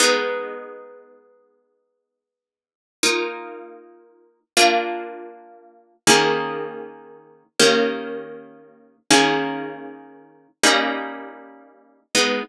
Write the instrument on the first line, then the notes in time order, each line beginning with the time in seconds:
orchestral harp
0.00 G#3 B3 D#4
3.03 A#3 D#4 F4
4.57 A#3 D4 F4
6.07 D#3 A#3 C#4 G#4
7.59 D#3 A#3 C#4 G4
9.11 D#3 A#3 C#4 G#4
10.63 G3 A#3 C#4 D#4
12.15 G#3 B3 D#4